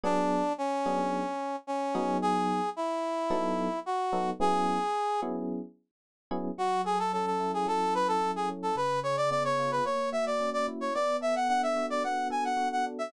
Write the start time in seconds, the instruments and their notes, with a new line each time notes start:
0.03 electric piano 1 F#3 B3 D4 G#4, brass section D4
0.58 brass section C#4
0.86 electric piano 1 F#3 B3 D4 G#4
1.67 brass section C#4
1.95 electric piano 1 F#3 B3 D#4 G#4
2.22 brass section G#4
2.76 brass section E4
3.30 electric piano 1 F#3 B3 D#4 A4
3.86 brass section F#4
4.12 electric piano 1 F#3 B3 D#4 A4
4.40 electric piano 1 F#3 B3 C#4 E4 G#4, brass section G#4
5.22 electric piano 1 F#3 B3 C#4 E4 G#4
6.31 electric piano 1 F#3 B3 C#4 E4 G#4
6.58 electric piano 1 F#3, brass section F#4
6.84 brass section G#4, electric piano 1 A4
6.99 brass section A4
7.13 electric piano 1 C#4, brass section A4
7.26 brass section A4
7.40 electric piano 1 E4
7.54 brass section G#4
7.66 electric piano 1 F#3, brass section A4
7.94 electric piano 1 A4, brass section B4
8.08 brass section A4
8.21 electric piano 1 E4
8.36 brass section G#4
8.49 electric piano 1 C#4
8.63 brass section A4
8.75 electric piano 1 C#3, brass section B4
9.03 electric piano 1 G#4, brass section C#5
9.17 brass section D5
9.30 electric piano 1 B3, brass section D5
9.44 brass section C#5
9.59 electric piano 1 F4
9.71 brass section B4
9.85 electric piano 1 A#3, brass section C#5
10.12 electric piano 1 F#4, brass section E5
10.26 brass section D5
10.40 electric piano 1 C#4
10.53 brass section D5
10.68 electric piano 1 E4
10.81 brass section C#5
10.94 electric piano 1 B3, brass section D5
11.21 electric piano 1 A4, brass section E5
11.35 brass section F#5
11.49 electric piano 1 D4, brass section F#5
11.63 brass section E5
11.76 electric piano 1 F#4
11.90 brass section D5
12.04 electric piano 1 B3, brass section F#5
12.30 electric piano 1 A4, brass section G#5
12.44 brass section F#5
12.57 electric piano 1 F#4
12.72 brass section F#5
12.86 electric piano 1 D4
12.99 brass section E5